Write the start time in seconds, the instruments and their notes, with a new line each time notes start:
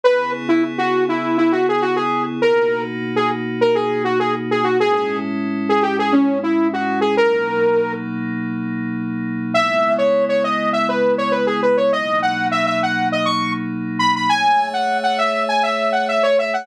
0.03 pad 5 (bowed) C#3 B3 E4 G#4, lead 2 (sawtooth) B4
0.48 lead 2 (sawtooth) E4
0.78 lead 2 (sawtooth) F#4
1.09 lead 2 (sawtooth) E4
1.37 lead 2 (sawtooth) E4
1.52 lead 2 (sawtooth) F#4
1.69 lead 2 (sawtooth) G#4
1.82 lead 2 (sawtooth) F#4
1.96 lead 2 (sawtooth) G#4
2.42 pad 5 (bowed) B2 A#3 D#4 F#4, lead 2 (sawtooth) A#4
3.16 lead 2 (sawtooth) G#4
3.61 lead 2 (sawtooth) A#4
3.75 lead 2 (sawtooth) G#4
4.04 lead 2 (sawtooth) F#4
4.19 lead 2 (sawtooth) G#4
4.51 lead 2 (sawtooth) G#4
4.64 lead 2 (sawtooth) F#4
4.79 pad 5 (bowed) A2 G#3 C#4 E4, lead 2 (sawtooth) G#4
4.93 lead 2 (sawtooth) G#4
5.69 lead 2 (sawtooth) G#4
5.82 lead 2 (sawtooth) G4
5.99 lead 2 (sawtooth) G#4
6.12 lead 2 (sawtooth) C#4
6.43 lead 2 (sawtooth) E4
6.73 lead 2 (sawtooth) F#4
7.01 lead 2 (sawtooth) G#4
7.17 pad 5 (bowed) B2 F#3 A#3 D#4, lead 2 (sawtooth) A#4
9.54 pad 5 (bowed) C#3 G#3 B3 E4, lead 2 (sawtooth) E5
9.98 lead 2 (sawtooth) C#5
10.29 lead 2 (sawtooth) C#5
10.44 lead 2 (sawtooth) D#5
10.73 lead 2 (sawtooth) E5
10.89 lead 2 (sawtooth) B4
11.18 lead 2 (sawtooth) C#5
11.32 lead 2 (sawtooth) B4
11.47 lead 2 (sawtooth) G#4
11.62 lead 2 (sawtooth) B4
11.77 lead 2 (sawtooth) C#5
11.92 pad 5 (bowed) B2 F#3 A#3 D#4, lead 2 (sawtooth) D#5
12.22 lead 2 (sawtooth) F#5
12.51 lead 2 (sawtooth) E5
12.66 lead 2 (sawtooth) E5
12.83 lead 2 (sawtooth) F#5
13.12 lead 2 (sawtooth) D#5
13.25 lead 2 (sawtooth) C#6
13.99 lead 2 (sawtooth) B5
14.16 lead 2 (sawtooth) B5
14.29 pad 5 (bowed) A3 G#4 C#5 E5, lead 2 (sawtooth) G#5
14.73 lead 2 (sawtooth) F#5
15.03 lead 2 (sawtooth) F#5
15.18 lead 2 (sawtooth) E5
15.48 lead 2 (sawtooth) G#5
15.63 lead 2 (sawtooth) E5
15.92 lead 2 (sawtooth) F#5
16.08 lead 2 (sawtooth) E5
16.23 lead 2 (sawtooth) C#5
16.39 lead 2 (sawtooth) E5
16.53 lead 2 (sawtooth) F#5